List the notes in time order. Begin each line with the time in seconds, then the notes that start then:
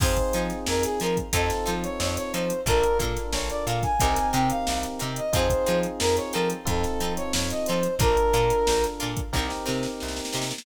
0.00 F2 C4 D#4 F4 G#4 C5, kick, crash
0.17 kick, closed hi-hat
0.33 F3 D#4 F4 G#4 C5, closed hi-hat
0.50 snare, closed hi-hat
0.66 F2 A#4, snare
0.83 G#4, snare, closed hi-hat
1.00 F3 D#4 F4 G#4 A#4 C5, closed hi-hat
1.17 kick, closed hi-hat
1.33 F2 C4 D#4 F4 A4 C5, kick, closed hi-hat
1.50 snare, closed hi-hat
1.66 F3 D#4 F4 A4 C5, snare, closed hi-hat
1.83 C#5, closed hi-hat
2.00 F2 C#5, snare
2.17 C#5, closed hi-hat
2.33 F3 D#4 F4 A4 C5, closed hi-hat
2.50 closed hi-hat
2.66 A#1 D4 F4 A4 A#4, kick, closed hi-hat
2.83 closed hi-hat
2.99 A#2 D4 F4 A4 A#4, kick, closed hi-hat
3.16 snare, closed hi-hat
3.33 A#1 C#5, snare
3.50 D5, closed hi-hat
3.66 A#2 D4 F4 A4 A#4 F5, closed hi-hat
3.83 G#5, kick, snare, closed hi-hat
4.00 C2 C4 D#4 G4 A#4, kick, closed hi-hat
4.16 snare, closed hi-hat
4.33 C3 C4 D#4 G4 A#4 G5, closed hi-hat
4.50 F5, closed hi-hat
4.67 C2, snare
4.83 closed hi-hat
4.99 C3 C4 D#4 G4 A#4, closed hi-hat
5.16 D#5, closed hi-hat
5.33 F2 C4 D#4 F4 G#4 C5, kick, closed hi-hat
5.50 kick, closed hi-hat
5.66 F3 C4 D#4 F4 G#4, closed hi-hat
5.83 closed hi-hat
6.00 F2 A#4, snare
6.17 C#5, closed hi-hat
6.33 F3 C4 D#4 F4 A4 A#4, closed hi-hat
6.50 closed hi-hat
6.65 F2 C4 D#4 F4 A4, kick, closed hi-hat
6.83 snare, closed hi-hat
7.00 F3 C4 D#4 F4 A4, closed hi-hat
7.17 C#5, closed hi-hat
7.33 F2 C#5, snare
7.50 D#5, closed hi-hat
7.66 F3 C4 D#4 F4 A4 C5, closed hi-hat
7.83 closed hi-hat
7.99 A#1 D4 F4 A4 A#4, kick, closed hi-hat
8.17 closed hi-hat
8.33 A#2 D4 F4 A4 A#4, closed hi-hat
8.50 closed hi-hat
8.67 A#1, snare
8.84 closed hi-hat
9.00 A#2 D4 F4 A4 A#4, closed hi-hat
9.17 kick, closed hi-hat
9.33 C2 C4 D#4 G4 A#4, kick, snare
9.50 snare
9.66 C3 C4 D#4 G4 A#4, snare
9.83 snare
10.00 C2, snare
10.08 snare
10.16 snare
10.25 snare
10.33 C3 C4 D#4 G4 A#4, snare
10.42 snare
10.51 snare
10.58 snare